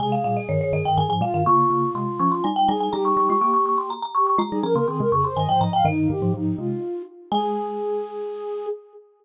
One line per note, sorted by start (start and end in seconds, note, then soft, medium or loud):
0.00 0.24 C3 medium
0.00 0.24 G#3 loud
0.00 1.08 G#4 medium
0.00 0.12 G#5 medium
0.12 0.24 F5 medium
0.24 0.47 A#2 medium
0.24 0.47 G3 medium
0.24 0.36 F5 medium
0.37 0.48 D#5 medium
0.49 0.72 G2 medium
0.49 0.72 D#3 loud
0.49 0.60 C#5 medium
0.61 0.73 C#5 medium
0.73 0.84 G2 medium
0.73 0.84 D#3 medium
0.73 0.85 D#5 medium
0.85 0.97 G2 medium
0.85 0.97 D#3 medium
0.85 0.97 G5 medium
0.97 1.09 G2 medium
0.97 1.09 D#3 medium
0.97 1.09 G#5 medium
1.09 1.20 G#2 medium
1.09 1.20 F3 medium
1.09 1.21 G#5 medium
1.21 1.33 A#2 medium
1.21 1.33 G3 medium
1.21 1.43 F4 medium
1.21 1.34 F5 medium
1.34 1.45 G2 medium
1.34 1.45 D#3 medium
1.34 1.46 F5 medium
1.45 1.70 C#3 medium
1.45 1.70 A#3 loud
1.45 2.46 F4 medium
1.45 1.90 C#6 loud
1.70 1.90 C#3 medium
1.70 1.90 A#3 medium
1.95 2.18 C3 medium
1.95 2.18 G#3 medium
1.95 2.18 C6 medium
2.20 2.40 F3 medium
2.20 2.40 C#4 medium
2.20 2.31 C#6 medium
2.32 2.43 C6 medium
2.44 2.68 G3 medium
2.44 2.68 D#4 medium
2.44 2.55 G#5 medium
2.56 2.68 G5 medium
2.68 2.89 G3 medium
2.68 2.89 D#4 loud
2.68 2.92 G#4 medium
2.68 2.80 G#5 medium
2.80 2.92 G#5 medium
2.91 3.16 G3 medium
2.91 3.16 D#4 medium
2.91 3.90 G4 medium
2.91 3.04 A#5 medium
3.05 3.16 C#6 medium
3.17 3.28 G3 medium
3.17 3.28 D#4 medium
3.17 3.29 C#6 medium
3.29 3.41 G#3 medium
3.29 3.41 F4 medium
3.29 3.41 C#6 medium
3.41 4.06 A#3 medium
3.41 4.06 G4 loud
3.41 3.53 C#6 medium
3.54 3.65 C#6 medium
3.66 3.77 C#6 medium
3.78 3.90 C6 medium
3.90 4.02 A#5 medium
4.02 4.14 A#5 medium
4.15 4.37 G4 medium
4.15 4.26 C#6 medium
4.27 4.38 C#6 medium
4.38 4.50 G#3 loud
4.38 4.50 F4 loud
4.38 4.63 A#5 medium
4.50 4.64 G3 medium
4.50 4.64 D#4 loud
4.50 4.61 G#4 medium
4.63 4.75 F3 medium
4.63 4.75 C#4 medium
4.63 4.74 A#4 medium
4.63 4.75 A#5 medium
4.75 4.87 C#3 medium
4.75 4.87 A#3 medium
4.75 4.87 A#4 medium
4.75 4.87 C6 medium
4.87 5.00 D#3 medium
4.87 5.00 C4 medium
4.87 4.98 G#4 medium
4.87 5.10 C6 medium
4.99 5.12 C3 medium
4.99 5.12 G#3 medium
4.99 5.11 A#4 medium
5.12 5.35 F2 medium
5.12 5.35 C#3 medium
5.12 5.24 G#4 medium
5.12 5.24 C#6 medium
5.24 5.36 C5 medium
5.24 5.36 C6 medium
5.37 5.48 G2 medium
5.37 5.48 D#3 medium
5.37 5.48 D#5 medium
5.37 5.48 G#5 medium
5.49 5.60 G#2 medium
5.49 5.60 F3 medium
5.49 5.61 C5 medium
5.49 5.60 G5 medium
5.60 5.81 G#2 medium
5.60 5.81 F3 medium
5.60 5.71 D#5 medium
5.60 5.73 A#5 medium
5.73 5.86 F5 medium
5.73 5.85 G5 medium
5.85 6.08 G2 medium
5.85 6.08 D#3 loud
5.85 6.09 D#4 medium
5.85 6.79 D#5 medium
6.10 6.21 G2 medium
6.10 6.21 D#3 medium
6.10 6.33 G4 medium
6.22 6.34 G#2 medium
6.22 6.34 F3 loud
6.34 6.55 G#2 medium
6.34 6.55 F3 medium
6.34 6.57 D#4 medium
6.58 6.80 C3 medium
6.58 6.80 G#3 medium
6.58 7.02 F4 medium
7.31 8.67 G#3 loud
7.31 8.66 G#4 loud
7.31 8.67 G#5 loud